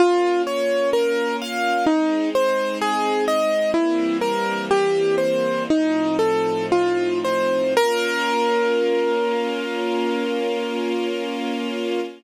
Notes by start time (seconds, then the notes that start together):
0.00 A#3 C#4 F4
0.47 C#5
0.93 A#4
1.42 F5
1.87 G#3 C4 D#4
2.35 C5
2.81 G#4
3.28 D#5
3.74 E3 G3 A#3 C4 E4
4.21 A#4
4.71 G4
5.18 C5
5.69 A2 F3 C4 D#4
6.19 A4
6.72 F4
7.25 C5
7.76 A#3 C#4 F4 A#4